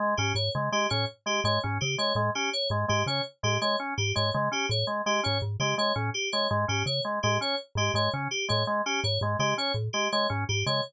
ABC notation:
X:1
M:6/4
L:1/8
Q:1/4=166
K:none
V:1 name="Marimba" clef=bass
z ^G,, G,, ^C, z A,, z2 G,, G,, C, z | A,, z2 ^G,, G,, ^C, z A,, z2 G,, G,, | ^C, z A,, z2 ^G,, G,, C, z A,, z2 | ^G,, G,, ^C, z A,, z2 G,, G,, C, z A,, |
z2 ^G,, G,, ^C, z A,, z2 G,, G,, C, |]
V:2 name="Drawbar Organ"
^G, ^C z G, G, C z G, G, C z G, | ^G, ^C z G, G, C z G, G, C z G, | ^G, ^C z G, G, C z G, G, C z G, | ^G, ^C z G, G, C z G, G, C z G, |
^G, ^C z G, G, C z G, G, C z G, |]
V:3 name="Electric Piano 2"
z G ^c z G c z G c z G c | z G ^c z G c z G c z G c | z G ^c z G c z G c z G c | z G ^c z G c z G c z G c |
z G ^c z G c z G c z G c |]